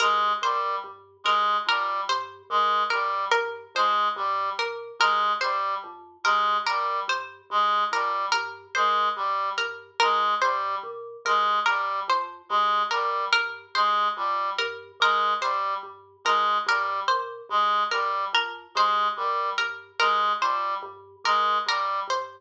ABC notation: X:1
M:9/8
L:1/8
Q:3/8=48
K:none
V:1 name="Vibraphone" clef=bass
G,, _B,, G,, G,, F,, G,, B,, G,, G,, | F,, G,, _B,, G,, G,, F,, G,, B,, G,, | G,, F,, G,, _B,, G,, G,, F,, G,, B,, | G,, G,, F,, G,, _B,, G,, G,, F,, G,, |
_B,, G,, G,, F,, G,, B,, G,, G,, F,, | G,, _B,, G,, G,, F,, G,, B,, G,, G,, |]
V:2 name="Clarinet" clef=bass
_A, G, z A, G, z A, G, z | _A, G, z A, G, z A, G, z | _A, G, z A, G, z A, G, z | _A, G, z A, G, z A, G, z |
_A, G, z A, G, z A, G, z | _A, G, z A, G, z A, G, z |]
V:3 name="Harpsichord"
_B c z B B c z B B | c z _B B c z B B c | z _B B c z B B c z | _B B c z B B c z B |
_B c z B B c z B B | c z _B B c z B B c |]